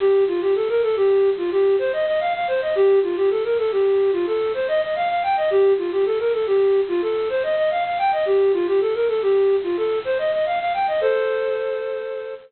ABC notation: X:1
M:5/4
L:1/16
Q:1/4=109
K:Cdor
V:1 name="Flute"
G2 F G A B A G3 F G2 c e e f f c e | G2 F G A B A G3 F A2 c e e f f g e | G2 F G A B A G3 F A2 c e e f f g e | G2 F G A B A G3 F A2 c e e f f g e |
[Ac]12 z8 |]